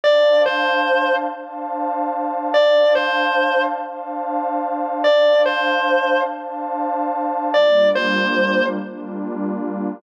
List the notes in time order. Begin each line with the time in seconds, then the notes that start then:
0.04 D4 C5 D5 F5 A5
0.46 C5
1.30 D4 C5 F5 A5
2.54 D4 C5 D5 F5 A5
2.95 C5
3.79 D4 C5 F5 A5
5.03 D4 C5 D5 F5 A5
5.46 C5
6.29 D4 C5 F5 A5
7.54 G3 A#3 D4 F4 D5
7.95 C5
8.79 G3 A#3 D4 F4